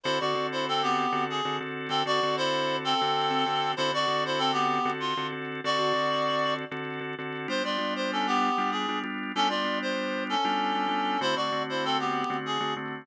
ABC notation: X:1
M:12/8
L:1/8
Q:3/8=129
K:D
V:1 name="Clarinet"
[E=c] [Fd]2 [Ec] [=CA] [B,G]3 ^G2 z2 | [=CA] [Fd]2 [E=c]3 [CA]6 | [E=c] [Fd]2 [Ec] [=CA] [B,G]3 =F2 z2 | [Fd]6 z6 |
=c [=Fd]2 c [^CA] [B,G]3 ^G2 z2 | [CA] [=Fd]2 =c3 [^CA]6 | [E=c] [Fd]2 [Ec] [=CA] [B,G]3 ^G2 z2 |]
V:2 name="Drawbar Organ"
[D,=CFA] [D,CFA] [D,CFA]5 [D,CFA]2 [D,CFA] [D,CFA]2 | [D,=CFA] [D,CFA] [D,CFA]5 [D,CFA]2 [D,CFA] [D,CFA]2 | [D,=CFA] [D,CFA] [D,CFA]5 [D,CFA]2 [D,CFA] [D,CFA]2 | [D,=CFA] [D,CFA] [D,CFA]5 [D,CFA]2 [D,CFA] [D,CFA]2 |
[G,B,D=F] [G,B,DF] [G,B,DF]5 [G,B,DF]2 [G,B,DF] [G,B,DF]2 | [G,B,D=F] [G,B,DF] [G,B,DF]5 [G,B,DF]2 [G,B,DF] [G,B,DF]2 | [D,A,=CF] [D,A,CF] [D,A,CF]5 [D,A,CF]2 [D,A,CF] [D,A,CF]2 |]